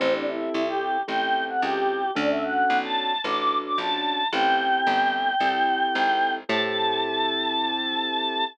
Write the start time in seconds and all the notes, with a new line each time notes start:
0.00 A1 C4 E4 G4 A4
0.14 D4
0.27 E4
0.54 C2
0.68 G4
1.08 A1 C4 E4 G4 A4 G5
1.48 F#5
1.62 C#2 G4
2.15 D2 C#4 D4 F#4 A4 D5
2.30 E5
2.43 F#5
2.70 B1
2.84 A5
3.24 A1 C#4 D4 F#4 A4 D6
3.65 D6
3.78 A#1 A5
4.33 A1 C4 E4 G4 A4 G5
4.87 G1
5.40 C2 C4 E4 G4 A4
5.95 G#1
6.49 A2 C4 E4 G4 A4 A5